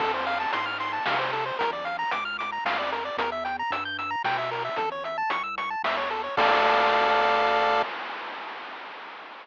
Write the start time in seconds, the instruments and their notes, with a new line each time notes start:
0.00 synth bass 1 F2, lead 1 (square) A4, kick, crash
0.14 lead 1 (square) C5
0.27 lead 1 (square) F5, closed hi-hat
0.40 lead 1 (square) A5
0.53 synth bass 1 G#2, lead 1 (square) C6, closed hi-hat
0.66 lead 1 (square) F6
0.80 lead 1 (square) C6, closed hi-hat
0.93 lead 1 (square) A5
1.06 synth bass 1 C3, lead 1 (square) F5, snare
1.19 lead 1 (square) C5
1.33 lead 1 (square) A4, closed hi-hat
1.46 lead 1 (square) C5
1.59 synth bass 1 A#1, lead 1 (square) A#4, kick, closed hi-hat
1.73 lead 1 (square) D5
1.85 lead 1 (square) F5, closed hi-hat
1.99 lead 1 (square) A#5
2.11 synth bass 1 C#2, lead 1 (square) D6, closed hi-hat
2.25 lead 1 (square) F6
2.39 lead 1 (square) D6, closed hi-hat
2.52 lead 1 (square) A#5
2.65 synth bass 1 F2, lead 1 (square) F5, snare
2.79 lead 1 (square) D5
2.92 lead 1 (square) A#4, closed hi-hat
3.05 lead 1 (square) D5
3.17 synth bass 1 E2, lead 1 (square) A#4, kick, closed hi-hat
3.32 lead 1 (square) E5
3.45 lead 1 (square) G5, closed hi-hat
3.59 lead 1 (square) A#5
3.70 synth bass 1 G2, lead 1 (square) E6, closed hi-hat
3.85 lead 1 (square) G6
3.99 lead 1 (square) E6, closed hi-hat
4.11 lead 1 (square) A#5
4.24 synth bass 1 B2, lead 1 (square) G5, snare
4.38 lead 1 (square) E5
4.51 lead 1 (square) A#4, open hi-hat
4.65 lead 1 (square) E5
4.76 synth bass 1 A1, lead 1 (square) A4, kick, closed hi-hat
4.92 lead 1 (square) C#5
5.04 lead 1 (square) E5, closed hi-hat
5.18 lead 1 (square) A5
5.30 synth bass 1 C2, lead 1 (square) C#6, closed hi-hat
5.43 lead 1 (square) E6
5.58 lead 1 (square) C#6, closed hi-hat
5.70 lead 1 (square) A5
5.84 synth bass 1 E2, lead 1 (square) E5, snare
5.97 lead 1 (square) C#5
6.10 lead 1 (square) A4, closed hi-hat
6.24 lead 1 (square) C#5
6.37 synth bass 1 D2, lead 1 (square) A4 D5 F5, kick, crash